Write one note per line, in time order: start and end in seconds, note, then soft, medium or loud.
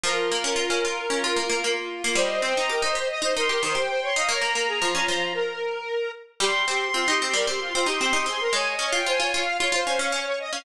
0.04 0.29 F3 medium
0.04 0.27 F4 loud
0.04 1.73 A#4 medium
0.31 0.44 A#3 medium
0.31 0.43 F4 medium
0.44 0.57 C#4 medium
0.44 0.56 F4 medium
0.56 0.68 F4 medium
0.56 0.80 F4 medium
0.70 0.83 C#4 medium
0.83 0.96 F4 medium
0.83 1.07 F4 medium
1.10 1.23 C#4 medium
1.10 1.22 F4 medium
1.23 1.36 F4 medium
1.23 1.37 F4 medium
1.36 1.49 A#3 medium
1.36 1.49 F4 medium
1.49 1.62 A#3 medium
1.49 1.62 F4 medium
1.63 2.02 A#3 medium
1.63 1.76 F4 medium
1.76 1.89 F4 medium
1.90 2.02 F4 medium
2.03 2.17 A#3 medium
2.03 2.15 F4 medium
2.15 2.41 G3 medium
2.15 2.42 C5 loud
2.15 2.40 D#5 loud
2.42 2.55 C4 medium
2.42 2.69 C5 medium
2.42 2.55 G5 medium
2.56 2.70 D#4 medium
2.56 2.69 A#5 medium
2.69 2.82 G4 medium
2.69 2.82 A#4 medium
2.69 2.92 D#5 medium
2.82 2.95 D#4 medium
2.82 2.95 C5 medium
2.95 3.19 G4 medium
2.95 3.09 C5 medium
2.95 3.09 D#5 medium
3.10 3.22 D#5 medium
3.22 3.34 D#4 medium
3.22 3.34 C5 medium
3.22 3.35 D#5 medium
3.35 3.49 D#4 medium
3.35 3.48 A#4 medium
3.35 3.48 C6 medium
3.49 3.62 G4 medium
3.49 3.62 A#4 medium
3.49 3.61 C6 medium
3.62 3.75 D#3 medium
3.62 3.75 C5 medium
3.62 3.75 C6 medium
3.75 4.08 G4 medium
3.75 3.87 C5 medium
3.75 3.88 G5 medium
3.88 4.00 C5 medium
3.88 4.01 G5 medium
4.02 4.15 C#5 medium
4.02 4.15 C6 medium
4.16 4.29 D#4 medium
4.16 4.29 D#5 medium
4.16 4.28 F5 medium
4.28 4.41 A#3 medium
4.28 4.42 C#5 medium
4.28 5.28 A#5 loud
4.41 4.54 A#3 medium
4.41 4.54 A#4 medium
4.54 4.81 A#3 medium
4.54 4.67 A#4 medium
4.67 4.80 G#4 medium
4.82 4.94 F3 medium
4.82 5.33 F4 medium
4.95 5.07 C#4 medium
5.08 5.85 F3 medium
5.34 6.12 A#4 medium
6.40 6.64 G3 medium
6.40 6.65 G4 loud
6.40 6.62 C6 medium
6.66 6.90 C4 medium
6.66 6.88 G4 medium
6.66 6.80 C6 medium
6.81 6.93 C6 medium
6.94 7.07 C4 medium
6.94 7.07 F4 medium
6.94 7.19 C6 loud
7.08 7.20 D#4 medium
7.08 7.20 G4 medium
7.20 7.35 C4 medium
7.20 7.34 G4 medium
7.20 7.33 C6 medium
7.34 7.46 G3 medium
7.34 7.46 A#4 medium
7.47 7.71 C4 medium
7.47 7.60 G4 medium
7.47 7.60 C6 medium
7.60 7.73 F4 medium
7.60 7.73 C6 medium
7.73 7.88 C4 medium
7.73 7.87 F4 medium
7.73 7.86 C6 medium
7.86 7.99 D#4 medium
7.86 7.99 G4 loud
7.86 8.00 C6 medium
8.00 8.13 C4 medium
8.00 8.12 G4 loud
8.00 8.13 C6 medium
8.13 8.26 D#4 medium
8.13 8.26 G4 medium
8.13 8.26 C6 loud
8.26 8.49 C4 medium
8.26 8.40 G#4 medium
8.26 8.40 C6 medium
8.40 8.53 A#4 medium
8.40 8.53 C6 medium
8.53 8.75 G#3 medium
8.53 8.76 C#5 medium
8.53 8.66 G#5 loud
8.66 8.90 D#5 medium
8.79 8.91 C#4 medium
8.79 9.04 C#5 medium
8.92 9.05 F4 medium
8.92 9.06 G5 medium
9.06 9.19 F4 medium
9.06 9.19 C5 medium
9.06 9.31 G#5 medium
9.20 9.32 F4 medium
9.20 9.33 C#5 medium
9.33 9.59 F4 medium
9.33 9.46 C#5 medium
9.33 9.55 F5 medium
9.45 9.58 F5 medium
9.59 9.72 F4 medium
9.59 9.73 C#5 medium
9.59 10.06 F5 medium
9.72 9.85 F4 medium
9.72 9.86 C5 medium
9.86 9.99 C#4 medium
9.86 9.99 C5 medium
9.99 10.12 C#4 medium
9.99 10.12 C#5 medium
10.12 10.50 C#4 medium
10.12 10.26 C#5 medium
10.26 10.39 C#5 loud
10.39 10.52 D#5 medium
10.52 10.64 C#4 medium
10.52 10.64 F5 medium